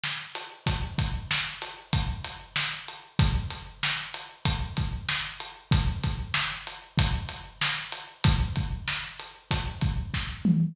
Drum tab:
HH |-x|xx-xxx-x|xx-xxx-x|xx-xxx-x|
SD |o-|--o---o-|--o---o-|--o---o-|
T2 |--|--------|--------|--------|
BD |--|oo--o---|o---oo--|oo--o---|

HH |xx-xxx--|
SD |--o---o-|
T2 |-------o|
BD |oo--ooo-|